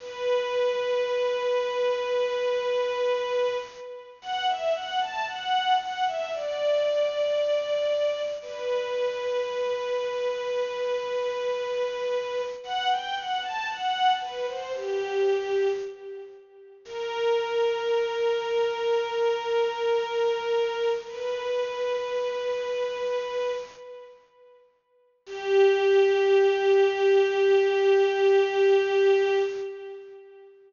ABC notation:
X:1
M:4/4
L:1/16
Q:1/4=57
K:G
V:1 name="String Ensemble 1"
B16 | f e f a f2 f e d8 | B16 | f g f a f2 B c G4 z4 |
^A16 | B10 z6 | G16 |]